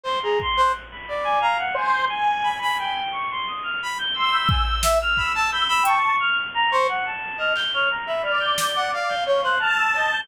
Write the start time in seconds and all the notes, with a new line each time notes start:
0.04 C5 C6
0.23 G#4 A#5
0.40 C6, kick
0.57 C5 F#6
0.91 B5
1.08 D5
1.24 G#5
1.41 F5 A#5
1.58 F#5
1.74 C5 G#5
1.92 C6
2.09 G#5
2.44 B5
2.62 B5
2.78 G5 B5
3.11 C#6
3.30 C6
3.47 D#6
3.63 F6
3.83 B5
3.98 G6
4.14 C6 E6
4.32 B5 G6
4.48 G#5 G6, kick
4.65 G6
4.83 E5, snare
5.02 F6
5.17 B5 E6, kick
5.35 A5
5.52 B5 G6
5.68 B5 E6
5.83 G5 A5 C#6, closed hi-hat
6.20 F6
6.54 A#5
6.71 C5 C#6
6.88 F#5
7.06 A5
7.38 D#5 F6
7.55 G6, clap
7.73 C#5 F6
7.90 A#5
8.07 E5 B5
8.23 D5 F6
8.40 G6
8.58 G6, snare
8.76 F#5
8.93 F5
9.09 G6
9.25 C#5 F5 G6
9.43 C5 F#6
9.60 A5 F6
9.76 E6
9.94 D#5 G6, cowbell
10.11 G6